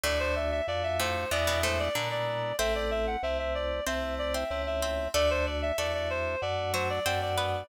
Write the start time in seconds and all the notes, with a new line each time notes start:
0.03 D2 A2 A3 D4 F#4 D5
0.20 C5
0.36 E5
0.51 E5
0.67 F2 A3 D4 F#4 D5
0.83 E5
0.99 A2 A3 C5
1.31 E2 B2 G#3 B3 D4 E4 D5
1.47 B2 B3
1.63 A2 A3 C5
1.79 D5
1.95 A#2 D3 G#3 B3 D4 E4
2.11 D5
2.59 A1 A3 C4 E4 C5 E5
2.75 D5
2.91 E5
3.07 F#5
3.23 C2 A3 C4 E4 E5
3.39 E5
3.55 D5
3.86 C2 A3 C4 E4 C5 E5
4.18 D5
4.34 C4 C5 E5
4.50 C#2 A3 C4 E4
4.67 E5
4.82 C4 C5
5.14 D2 A3 D4 F#4 A4 D5
5.30 C5
5.46 D5
5.62 E5
5.78 E2 A3 D4 F#4 A4 D5
5.94 D5
6.10 C5
6.42 F#2 A3 D4 F#4 D5
6.74 F#3 F#4 C5
6.90 D5
7.06 F#2 A3 C4 D4 F#4 C5
7.22 D5
7.38 B3 B4